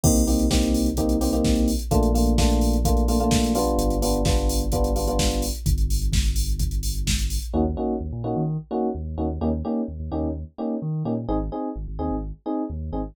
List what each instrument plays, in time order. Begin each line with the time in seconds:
0.03 synth bass 2 C2, electric piano 1 A#3 C4 D#4 G4, kick, crash
0.16 closed hi-hat
0.27 electric piano 1 A#3 C4 D#4 G4, open hi-hat
0.39 closed hi-hat
0.50 electric piano 1 A#3 C4 D#4 G4, kick, snare
0.62 closed hi-hat
0.74 open hi-hat
0.86 closed hi-hat
0.97 electric piano 1 A#3 C4 D#4 G4, kick, closed hi-hat
1.09 closed hi-hat
1.21 electric piano 1 A#3 C4 D#4 G4, open hi-hat
1.33 electric piano 1 A#3 C4 D#4 G4, closed hi-hat
1.44 kick, snare
1.55 closed hi-hat
1.68 open hi-hat
1.79 closed hi-hat
1.91 synth bass 2 A#1, electric piano 1 A3 A#3 D4 F4, kick, closed hi-hat
2.03 closed hi-hat
2.14 electric piano 1 A3 A#3 D4 F4, open hi-hat
2.26 closed hi-hat
2.38 electric piano 1 A3 A#3 D4 F4, kick, snare
2.50 closed hi-hat
2.61 open hi-hat
2.73 closed hi-hat
2.85 electric piano 1 A3 A#3 D4 F4, kick, closed hi-hat
2.97 closed hi-hat
3.08 electric piano 1 A3 A#3 D4 F4, open hi-hat
3.20 electric piano 1 A3 A#3 D4 F4, closed hi-hat
3.31 kick, snare
3.44 closed hi-hat
3.55 electric piano 1 G3 B3 D4 F4, open hi-hat
3.67 closed hi-hat
3.78 synth bass 2 G1, closed hi-hat
3.90 closed hi-hat
4.02 electric piano 1 G3 B3 D4 F4, open hi-hat
4.14 closed hi-hat
4.25 electric piano 1 G3 B3 D4 F4, kick, snare
4.37 closed hi-hat
4.49 open hi-hat
4.60 closed hi-hat
4.72 electric piano 1 G3 B3 D4 F4, kick, closed hi-hat
4.84 closed hi-hat
4.96 electric piano 1 G3 B3 D4 F4, open hi-hat
5.07 electric piano 1 G3 B3 D4 F4, closed hi-hat
5.19 kick, snare
5.31 closed hi-hat
5.42 open hi-hat
5.55 closed hi-hat
5.66 synth bass 2 G1, kick, closed hi-hat
5.78 closed hi-hat
5.90 open hi-hat
6.01 closed hi-hat
6.12 kick, snare
6.25 closed hi-hat
6.36 open hi-hat
6.49 closed hi-hat
6.59 kick, closed hi-hat
6.71 closed hi-hat
6.83 open hi-hat
6.95 closed hi-hat
7.07 kick, snare
7.19 closed hi-hat
7.30 open hi-hat
7.42 closed hi-hat
7.54 synth bass 2 D#2, electric piano 1 A#3 C#4 D#4 F#4
7.77 electric piano 1 A#3 C#4 D#4 F#4
8.00 synth bass 2 D#2
8.12 synth bass 2 A#2
8.24 synth bass 2 A#2, electric piano 1 A#3 C#4 D#4 F#4
8.36 synth bass 2 D#3
8.71 electric piano 1 A#3 C#4 D#4 F#4
8.95 synth bass 2 D#2
9.17 synth bass 2 D#2, electric piano 1 A#3 C#4 D#4 F#4
9.41 synth bass 2 D#2, electric piano 1 A#3 C#4 D#4 G4
9.65 electric piano 1 A#3 C#4 D#4 G4
9.88 synth bass 2 D#2
9.99 synth bass 2 D#2
10.12 synth bass 2 D#2, electric piano 1 A#3 C#4 D#4 G4
10.23 synth bass 2 D#2
10.58 electric piano 1 A#3 C#4 D#4 G4
10.82 synth bass 2 D#3
11.05 synth bass 2 A#2, electric piano 1 A#3 C#4 D#4 G4
11.28 synth bass 2 G#1, electric piano 1 C4 D#4 G#4
11.52 electric piano 1 C4 D#4 G#4
11.76 synth bass 2 G#1
11.88 synth bass 2 G#1
11.99 synth bass 2 D#2, electric piano 1 C4 D#4 G#4
12.11 synth bass 2 G#1
12.46 electric piano 1 C4 D#4 G#4
12.70 synth bass 2 D#2
12.92 synth bass 2 G#1, electric piano 1 C4 D#4 G#4